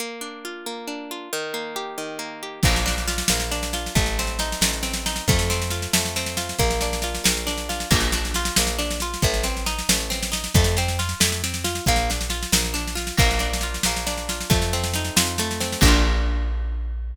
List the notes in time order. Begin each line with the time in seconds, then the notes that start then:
0.00 A#3
0.21 D4
0.45 F4
0.66 A#3
0.88 D4
1.11 F4
1.33 D#3
1.54 A#3
1.76 G4
1.98 D#3
2.19 A#3
2.43 G4
2.63 A#1 A#3, kick, snare, crash
2.76 snare
2.86 D4, snare
2.98 snare
3.08 F4, snare
3.18 snare
3.28 A#1 A#3, snare
3.40 snare
3.51 D4, snare
3.63 snare
3.73 F4, snare
3.86 snare
3.95 A1 A3, kick, snare
4.06 snare
4.19 C4, snare
4.27 snare
4.39 D#4, snare
4.52 snare
4.61 A1 A3, snare
4.73 snare
4.83 C4, snare
4.93 snare
5.06 D#4, snare
5.16 snare
5.28 F2 A3, kick, snare
5.39 snare
5.50 C4, snare
5.62 snare
5.70 F4, snare
5.82 snare
5.93 F2 A3, snare
6.05 snare
6.16 C4, snare
6.26 snare
6.37 F4, snare
6.49 snare
6.59 A#1 A#3, kick, snare
6.71 snare
6.81 D4, snare
6.93 snare
7.02 F4, snare
7.15 snare
7.24 A#1 A#3, snare
7.37 snare
7.47 D4, snare
7.58 snare
7.69 F4, snare
7.80 snare
7.91 A#1 A#3, kick, snare, crash
8.00 snare
8.12 D4, snare
8.25 snare
8.34 F4, snare
8.45 snare
8.56 A#1 A#3, snare
8.67 snare
8.79 D4, snare
8.91 snare
9.00 F4, snare
9.14 snare
9.22 A1 A3, kick, snare
9.34 snare
9.43 C4, snare
9.57 snare
9.66 D#4, snare
9.79 snare
9.89 A1 A3, snare
10.00 snare
10.10 C4, snare
10.23 snare
10.32 D#4, snare
10.44 snare
10.54 F2 A3, kick, snare
10.64 snare
10.77 C4, snare
10.88 snare
10.99 F4, snare
11.09 snare
11.20 F2 A3, snare
11.32 snare
11.44 C4, snare
11.54 snare
11.64 F4, snare
11.75 snare
11.86 A#1 A#3, kick, snare
11.96 snare
12.10 D4, snare
12.21 snare
12.30 F4, snare
12.43 snare
12.52 A#1 A#3, snare
12.65 snare
12.74 D4, snare
12.88 snare
12.95 F4, snare
13.07 snare
13.17 A#1 A#3, kick, snare, crash
13.31 snare
13.39 D4, snare
13.53 snare
13.61 F4, snare
13.74 snare
13.83 A#1 A#3, snare
13.96 snare
14.07 D4, snare
14.18 snare
14.29 F4, snare
14.41 snare
14.50 F2 A3, kick, snare
14.62 snare
14.73 C4, snare
14.84 snare
14.93 D#4, snare
15.04 snare
15.16 F2 F4, snare
15.27 snare
15.38 A3, snare
15.51 snare
15.60 C4, snare
15.72 snare
15.81 A#1 A#3, kick, crash
15.85 D4 F4